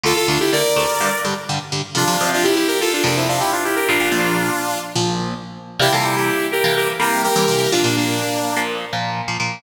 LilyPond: <<
  \new Staff \with { instrumentName = "Lead 2 (sawtooth)" } { \time 4/4 \key d \minor \tempo 4 = 125 <f' a'>16 <f' a'>16 <d' f'>16 <e' g'>16 <bes' d''>4. r4. | \key f \major <d' f'>8. <d' f'>16 <e' g'>16 <e' g'>16 <g' bes'>16 <f' a'>16 <d' f'>16 <bes d'>16 <c' e'>16 <d' f'>16 <e' g'>16 <d' f'>16 <e' g'>16 <g' bes'>16 | <d' f'>2 r2 | <e' g'>16 <f' a'>16 <e' g'>16 <e' g'>8. <g' bes'>8 <g' bes'>16 r16 <g' bes'>8 <g' bes'>4 |
<d' f'>16 <bes d'>16 <bes d'>4. r2 | }
  \new Staff \with { instrumentName = "Overdriven Guitar" } { \time 4/4 \key d \minor <d, d a>8 <d, d a>8 <d, d a>8 <d, d a>8 <g, d g>8 <g, d g>8 <g, d g>8 <g, d g>8 | \key f \major <f, c f>16 <f, c f>16 <f, c f>4.~ <f, c f>16 <f, c f>4.~ <f, c f>16 | <bes,, bes, f>16 <bes,, bes, f>16 <bes,, bes, f>4.~ <bes,, bes, f>16 <bes,, bes, f>4.~ <bes,, bes, f>16 | <c e g bes>16 <c e g bes>4. <c e g bes>8. <c e g bes>8. <c e g bes>16 <c e g bes>8 |
<bes, f bes>16 <bes, f bes>4. <bes, f bes>8. <bes, f bes>8. <bes, f bes>16 <bes, f bes>8 | }
>>